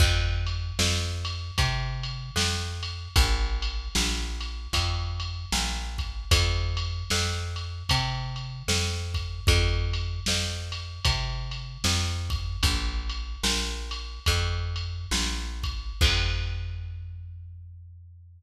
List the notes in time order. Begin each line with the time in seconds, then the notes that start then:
0.00 F2, kick, crash
0.47 ride
0.79 F2, snare
1.25 ride
1.58 C3, kick, ride
2.03 ride
2.36 F2, snare
2.83 ride
3.16 A#1, kick, ride
3.62 ride
3.95 A#1, snare
4.41 ride
4.73 F2, kick, ride
5.20 ride
5.52 A#1, snare
5.98 kick, ride
6.31 F2, kick, ride
6.77 ride
7.10 F2, snare
7.56 ride
7.89 C3, kick, ride
8.36 ride
8.68 F2, snare
9.14 kick, ride
9.47 F2, kick, ride
9.93 ride
10.26 F2, snare
10.72 ride
11.05 C3, kick, ride
11.51 ride
11.84 F2, snare
12.30 kick, ride
12.63 A#1, kick, ride
13.09 ride
13.43 A#1, snare
13.91 ride
14.26 F2, kick, ride
14.76 ride
15.11 A#1, snare
15.63 kick, ride
16.01 F2, kick, crash